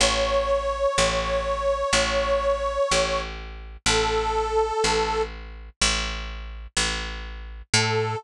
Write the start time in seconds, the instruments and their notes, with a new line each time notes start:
0.00 electric bass (finger) A1, harmonica C#5
0.98 electric bass (finger) A1
1.93 electric bass (finger) A1
2.92 electric bass (finger) A1
3.86 electric bass (finger) A1, harmonica A4
4.84 electric bass (finger) A1
5.81 electric bass (finger) A1
6.77 electric bass (finger) A1
7.74 electric bass (finger) A2, harmonica A4